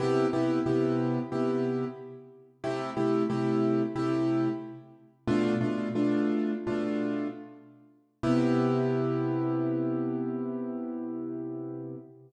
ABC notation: X:1
M:4/4
L:1/8
Q:1/4=91
K:C
V:1 name="Acoustic Grand Piano"
[C,B,EG] [C,B,EG] [C,B,EG]2 [C,B,EG]4 | [C,A,EG] [C,A,EG] [C,A,EG]2 [C,A,EG]4 | "^rit." [B,,A,DF] [B,,A,DF] [B,,A,DF]2 [B,,A,DF]4 | [C,B,EG]8 |]